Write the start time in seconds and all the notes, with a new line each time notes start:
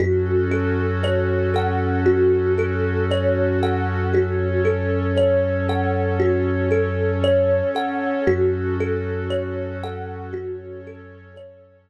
0.00 F#2 C#4 F#4 A4
0.51 A4
1.03 C#5
1.54 A4 F#5
2.06 F#4
2.58 A4
3.11 C#5
3.63 A4 F#5
4.13 C#4 F#4 A4 C#5
4.65 A4
5.17 C#5
5.69 A4 F#5
6.20 F#4
6.71 A4
7.24 C#5
7.75 A4 F#5
8.27 F#2 C#4 F#4 A4
8.80 A4
9.30 C#5
9.83 A4 F#5
10.33 C#4 F#4 A4 C#5
10.87 A4
11.36 C#5